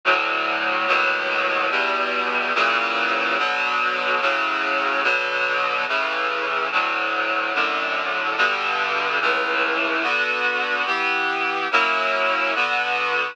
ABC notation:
X:1
M:4/4
L:1/8
Q:1/4=72
K:Bm
V:1 name="Clarinet"
[D,,A,,F,]2 [^D,,A,,B,,F,]2 [E,,B,,G,]2 [^A,,C,E,F,]2 | [B,,D,F,]2 [A,,C,F,]2 [B,,D,F,]2 [A,,C,E,]2 | [D,,A,,F,]2 [F,,A,,D,]2 [G,,B,,D,]2 [C,,A,,E,]2 | [D,B,F]2 [E,B,G]2 [F,^A,CE]2 [D,B,F]2 |]